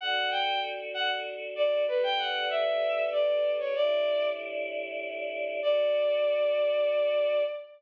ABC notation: X:1
M:3/4
L:1/16
Q:1/4=96
K:D
V:1 name="Violin"
f2 g2 z2 f z3 d2 | B g f2 e4 d3 c | d4 z8 | d12 |]
V:2 name="Choir Aahs"
[DFA]12 | [G,DAB]12 | [A,,G,DE]12 | [DFA]12 |]